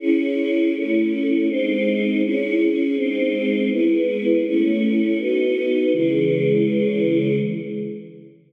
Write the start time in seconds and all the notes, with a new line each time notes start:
0.00 C#4 E4 G#4
0.74 A3 C#4 E4
1.48 G#3 C4 D#4
2.22 C#4 E4 G#4
2.96 G#3 C4 D#4
3.70 G#3 B3 E4
4.44 A3 C#4 E4
5.18 B3 D#4 F#4
5.93 C#3 E3 G#3